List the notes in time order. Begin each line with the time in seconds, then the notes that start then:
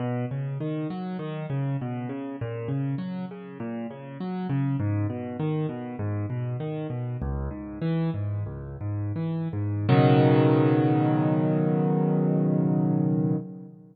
0.00 B2
0.31 C#3
0.60 D#3
0.90 F#3
1.19 D#3
1.50 C#3
1.81 B2
2.09 C#3
2.41 A#2
2.68 C#3
2.98 F#3
3.31 C#3
3.60 A#2
3.91 C#3
4.20 F#3
4.50 C#3
4.80 G#2
5.10 B2
5.40 D#3
5.69 B2
5.99 G#2
6.30 B2
6.60 D#3
6.90 B2
7.22 C#2
7.51 G#2
7.82 E3
8.14 G#2
8.46 C#2
8.81 G#2
9.16 E3
9.53 G#2
9.89 B2 C#3 D#3 F#3